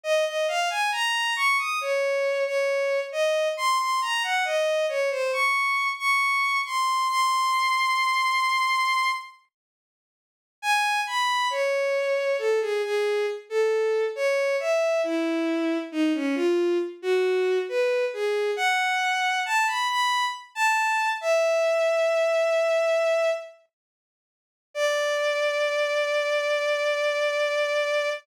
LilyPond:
\new Staff { \time 4/4 \key des \major \tempo 4 = 68 ees''16 ees''16 f''16 aes''16 bes''8 des'''16 ees'''16 des''8. des''8. ees''8 | c'''16 c'''16 bes''16 ges''16 ees''8 des''16 c''16 des'''8. des'''8. c'''8 | c'''2~ c'''8 r4. | \key cis \minor gis''8 b''8 cis''4 a'16 gis'16 gis'8 r16 a'8. |
cis''8 e''8 e'4 dis'16 cis'16 eis'8 r16 fis'8. | b'8 gis'8 fis''4 a''16 b''16 b''8 r16 a''8. | e''2~ e''8 r4. | \key d \minor d''1 | }